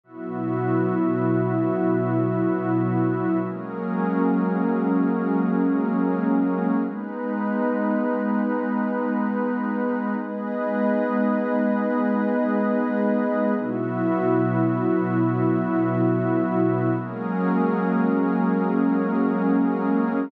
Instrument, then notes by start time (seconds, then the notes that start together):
pad 2 (warm)
0.04 B2 F#3 B3 E4 F#4 E5
3.42 F#3 G#3 A#3 C#4 G#4 A#4
6.79 G#3 B3 D#4 B4
10.17 G#3 B3 D#4 G#4 B4 D#5
13.55 B2 F#3 B3 E4 F#4 E5
16.94 F#3 G#3 A#3 C#4 G#4 A#4